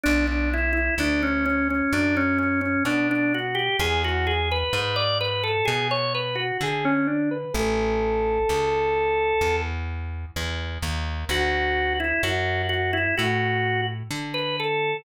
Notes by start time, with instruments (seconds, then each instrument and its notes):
0.04 electric bass (finger) B1, drawbar organ D4
0.27 drawbar organ D4
0.54 drawbar organ E4
0.73 drawbar organ E4
0.98 electric bass (finger) D2, drawbar organ D4
1.23 drawbar organ C#4
1.46 drawbar organ C#4
1.70 drawbar organ C#4
1.93 electric bass (finger) F#2, drawbar organ D4
2.17 drawbar organ C#4
2.38 drawbar organ C#4
2.61 drawbar organ C#4
2.85 electric bass (finger) B2, drawbar organ D4
3.11 drawbar organ D4
3.34 drawbar organ F#4
3.55 drawbar organ G4
3.79 electric bass (finger) E2, drawbar organ G#4
4.04 drawbar organ F#4
4.27 drawbar organ G#4
4.52 drawbar organ B4
4.73 electric bass (finger) G#2, drawbar organ B4
4.96 drawbar organ D5
5.21 drawbar organ B4
5.44 drawbar organ A4
5.65 electric bass (finger) B2, drawbar organ G#4
5.91 drawbar organ C#5
6.15 drawbar organ B4
6.36 drawbar organ F#4
6.61 electric bass (finger) D3, drawbar organ G#4
6.85 drawbar organ C#4
7.07 drawbar organ D4
7.31 drawbar organ B4
7.54 electric bass (finger) A1, drawbar organ A4
8.49 electric bass (finger) C#2
9.41 electric bass (finger) E2
10.36 electric bass (finger) E2
10.83 electric bass (finger) D#2
11.29 electric bass (finger) D2, drawbar organ F#4
12.00 drawbar organ E4
12.23 electric bass (finger) F#2, drawbar organ F#4
12.69 drawbar organ F#4
12.93 drawbar organ E4
13.18 electric bass (finger) A2, drawbar organ F#4
14.11 electric bass (finger) D3
14.34 drawbar organ B4
14.60 drawbar organ A4